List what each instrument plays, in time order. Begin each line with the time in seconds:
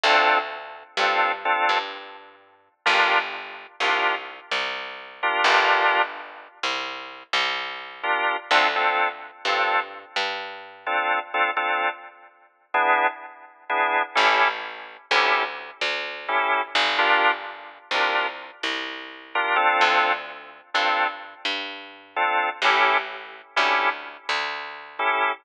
0.04 electric bass (finger) D2, drawbar organ C4 D4 F4 A4
0.97 electric bass (finger) G2, drawbar organ C4 D4 F4 A4
1.45 drawbar organ C4 D4 F4 A4
1.69 electric bass (finger) G2
2.86 electric bass (finger) G1, drawbar organ D4 F4 G4 A#4
3.80 electric bass (finger) C2, drawbar organ D4 F4 G4 A#4
4.51 electric bass (finger) C2
5.23 drawbar organ D4 F4 G4 A#4
5.44 electric bass (finger) G1, drawbar organ D4 F4 G4 A#4
6.63 electric bass (finger) C2
7.33 electric bass (finger) C2
8.03 drawbar organ D4 F4 G4 A#4
8.51 electric bass (finger) D2, drawbar organ C4 D4 F4 A4
8.76 drawbar organ C4 D4 F4 A4
9.45 electric bass (finger) G2, drawbar organ C4 D4 F4 A4
10.16 electric bass (finger) G2
10.86 drawbar organ C4 D4 F4 A4
11.34 drawbar organ C4 D4 F4 A4
11.57 drawbar organ C4 D4 F4 A4
12.74 drawbar organ B3 D4 E4 G#4
13.70 drawbar organ B3 D4 E4 G#4
14.15 electric bass (finger) A1, drawbar organ C#4 E4 G4 A4
15.11 electric bass (finger) D2, drawbar organ C#4 E4 G4 A4
15.81 electric bass (finger) D2
16.28 drawbar organ C#4 E4 G4 A4
16.75 electric bass (finger) G1
16.98 drawbar organ D4 F4 G4 A#4
17.91 electric bass (finger) C2, drawbar organ D4 F4 G4 A#4
18.63 electric bass (finger) C2
19.35 drawbar organ D4 F4 G4 A#4
19.56 drawbar organ C4 D4 F4 A4
19.81 electric bass (finger) D2
20.74 electric bass (finger) G2, drawbar organ C4 D4 F4 A4
21.45 electric bass (finger) G2
22.16 drawbar organ C4 D4 F4 A4
22.62 electric bass (finger) A1, drawbar organ C#4 E4 G4 A4
23.56 electric bass (finger) D2, drawbar organ C#4 E4 G4 A4
24.29 electric bass (finger) D2
24.99 drawbar organ C#4 E4 G4 A4